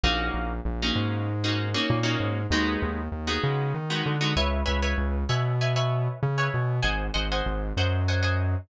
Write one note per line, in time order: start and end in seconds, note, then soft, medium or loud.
0.03 0.30 A#1 loud
0.03 0.53 A#3 loud
0.03 0.53 C#4 medium
0.03 0.53 D#4 loud
0.03 0.53 F#4 loud
0.34 0.60 A#1 medium
0.65 0.91 A#1 medium
0.82 1.32 A#3 medium
0.82 1.32 C#4 loud
0.82 1.32 D#4 medium
0.82 1.32 F#4 medium
0.95 1.74 G#2 medium
1.44 1.68 A#3 medium
1.44 1.68 C#4 medium
1.44 1.68 D#4 medium
1.44 1.68 F#4 medium
1.74 1.99 A#3 medium
1.74 1.99 C#4 medium
1.74 1.99 D#4 medium
1.74 1.99 F#4 medium
1.90 2.16 A#2 medium
2.03 2.40 A#3 medium
2.03 2.40 C#4 medium
2.03 2.40 D#4 medium
2.03 2.40 F#4 medium
2.20 2.46 G#2 medium
2.50 2.77 D#2 medium
2.50 3.01 G#3 loud
2.50 3.01 B3 loud
2.50 3.01 D#4 loud
2.50 3.01 F#4 loud
2.82 3.09 D#2 loud
3.12 3.38 D#2 medium
3.27 3.77 G#3 medium
3.27 3.77 B3 medium
3.27 3.77 D#4 medium
3.27 3.77 F#4 medium
3.43 3.73 C#3 medium
3.74 4.02 D#3 medium
3.90 4.15 G#3 medium
3.90 4.15 B3 medium
3.90 4.15 D#4 medium
3.90 4.15 F#4 medium
4.06 4.34 D3 medium
4.21 4.33 G#3 medium
4.21 4.33 B3 medium
4.21 4.33 D#4 medium
4.21 4.33 F#4 medium
4.36 4.63 C#2 loud
4.36 4.61 B4 loud
4.36 4.61 C#5 loud
4.36 4.61 E5 loud
4.36 4.61 G#5 loud
4.66 4.94 C#2 medium
4.66 4.78 B4 medium
4.66 4.78 C#5 medium
4.66 4.78 E5 medium
4.66 4.78 G#5 medium
4.82 5.19 B4 medium
4.82 5.19 C#5 medium
4.82 5.19 E5 medium
4.82 5.19 G#5 medium
4.98 5.24 C#2 medium
5.29 6.08 B2 medium
5.29 5.54 B4 medium
5.29 5.54 C#5 medium
5.29 5.54 E5 medium
5.29 5.54 G#5 medium
5.61 5.73 B4 medium
5.61 5.73 C#5 medium
5.61 5.73 E5 medium
5.61 5.73 G#5 medium
5.76 6.26 B4 medium
5.76 6.26 C#5 medium
5.76 6.26 E5 medium
5.76 6.26 G#5 medium
6.23 6.49 C#3 medium
6.38 6.75 B4 medium
6.38 6.75 C#5 medium
6.38 6.75 E5 medium
6.38 6.75 G#5 medium
6.54 6.80 B2 medium
6.82 7.10 G#1 medium
6.82 7.07 C5 medium
6.82 7.07 D#5 medium
6.82 7.07 F#5 medium
6.82 7.07 G#5 loud
7.14 7.41 G#1 medium
7.14 7.26 C5 medium
7.14 7.26 D#5 loud
7.14 7.26 F#5 medium
7.14 7.26 G#5 medium
7.32 7.69 C5 medium
7.32 7.69 D#5 medium
7.32 7.69 F#5 medium
7.32 7.69 G#5 loud
7.46 7.72 G#1 medium
7.77 8.56 F#2 medium
7.77 8.02 C5 medium
7.77 8.02 D#5 medium
7.77 8.02 F#5 medium
7.77 8.02 G#5 medium
8.08 8.20 C5 medium
8.08 8.20 D#5 medium
8.08 8.20 F#5 medium
8.08 8.20 G#5 loud
8.23 8.60 C5 medium
8.23 8.60 D#5 medium
8.23 8.60 F#5 medium
8.23 8.60 G#5 medium